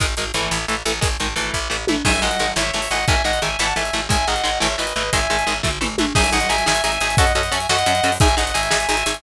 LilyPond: <<
  \new Staff \with { instrumentName = "Distortion Guitar" } { \time 6/8 \key gis \phrygian \tempo 4. = 117 r2. | r2. | <e'' gis''>8 <dis'' fis''>4 <cis'' e''>8 <cis'' e''>8 <dis'' fis''>8 | <e'' gis''>8 <dis'' fis''>8 <e'' gis''>8 <fis'' a''>8 <e'' gis''>4 |
<e'' gis''>8 <dis'' fis''>4 <cis'' e''>8 <b' dis''>8 <b' dis''>8 | <e'' gis''>4. r4. | <e'' gis''>8 <dis'' fis''>8 <e'' gis''>8 <e'' gis''>8 <e'' gis''>4 | <dis'' fis''>8 <dis'' fis''>8 <e'' gis''>8 <dis'' fis''>4. |
<e'' gis''>8 <dis'' fis''>8 <e'' gis''>8 <e'' gis''>8 <e'' gis''>4 | }
  \new Staff \with { instrumentName = "Overdriven Guitar" } { \time 6/8 \key gis \phrygian <dis gis>8 <dis gis>8 <e a>4 <e a>8 <e a>8 | <dis gis>8 <dis gis>8 <e a>4 <e a>8 <e a>8 | <dis gis>8 <dis gis>8 <dis gis>8 <e a>8 <e a>8 <e a>8 | <dis gis>8 <dis gis>8 <dis gis>8 <e a>8 <e a>8 <e a>8 |
<dis gis>8 <dis gis>8 <dis gis>8 <e a>8 <e a>8 <e a>8 | <dis gis>8 <dis gis>8 <dis gis>8 <e a>8 <e a>8 <e a>8 | <dis' gis'>8 <dis' gis'>8 <dis' gis'>8 <dis' gis'>8 <dis' gis'>8 <dis' gis'>8 | <cis' fis' a'>8 <cis' fis' a'>8 <cis' fis' a'>8 <cis' fis' a'>8 <cis' fis' a'>8 <cis' fis' a'>8 |
<dis' gis'>8 <dis' gis'>8 <dis' gis'>8 <dis' gis'>8 <dis' gis'>8 <dis' gis'>8 | }
  \new Staff \with { instrumentName = "Electric Bass (finger)" } { \clef bass \time 6/8 \key gis \phrygian gis,,8 gis,,8 gis,,8 a,,8 a,,8 a,,8 | gis,,8 gis,,8 gis,,8 a,,8 a,,8 a,,8 | gis,,8 gis,,8 gis,,8 gis,,8 gis,,8 gis,,8 | gis,,8 gis,,8 gis,,8 gis,,8 gis,,8 gis,,8 |
gis,,8 gis,,8 gis,,8 gis,,8 gis,,8 gis,,8 | gis,,8 gis,,8 gis,,8 gis,,8 gis,,8 gis,,8 | gis,,8 gis,,8 gis,,8 gis,,8 gis,,8 gis,,8 | fis,8 fis,8 fis,8 fis,8 fis,8 fis,8 |
gis,,8 g,,8 gis,,8 gis,,8 gis,,8 gis,,8 | }
  \new DrumStaff \with { instrumentName = "Drums" } \drummode { \time 6/8 <hh bd>8 hh8 hh8 sn8 hh8 hh8 | <hh bd>8 hh8 hh8 bd4 tommh8 | <cymc bd>8. hh8. sn8. hho8. | <hh bd>8. hh8. sn8. hh8. |
<hh bd>8. hh8. sn8. hh8. | <hh bd>8. hh8. <bd tomfh>8 toml8 tommh8 | <cymc bd>16 hh16 hh16 hh16 hh16 hh16 sn16 hh16 hh16 hh16 hh16 hh16 | <hh bd>16 hh16 hh16 hh16 hh16 hh16 sn16 hh16 hh16 hh16 hh16 hho16 |
<hh bd>16 hh16 hh16 hh16 hh16 hh16 sn16 hh16 hh16 hh16 hh16 hh16 | }
>>